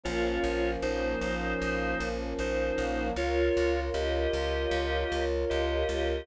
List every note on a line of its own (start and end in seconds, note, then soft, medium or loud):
0.04 0.39 A#1 loud
0.04 3.12 F3 medium
0.04 3.12 A#3 medium
0.04 3.12 C#4 medium
0.04 0.71 F4 loud
0.04 0.71 C#5 loud
0.44 0.77 A#1 loud
0.82 1.16 A#1 medium
0.82 2.09 D#4 medium
0.82 2.09 C5 loud
1.21 1.55 A#1 medium
1.62 1.95 A#1 medium
2.00 2.34 A#1 loud
2.39 2.72 A#1 medium
2.39 3.09 D#4 medium
2.39 3.09 C5 loud
2.78 3.11 A#1 medium
3.16 3.50 C#2 loud
3.16 6.25 F4 medium
3.16 3.80 F4 loud
3.16 6.25 A#4 medium
3.16 6.25 C#5 medium
3.16 3.80 C#5 loud
3.57 3.90 C#2 medium
3.94 4.27 C#2 loud
3.94 5.25 G4 medium
3.94 5.25 D#5 loud
4.33 4.67 C#2 medium
4.71 5.04 C#2 loud
5.12 5.45 C#2 medium
5.50 5.84 C#2 medium
5.50 6.26 G4 medium
5.50 6.26 D#5 loud
5.89 6.22 C#2 medium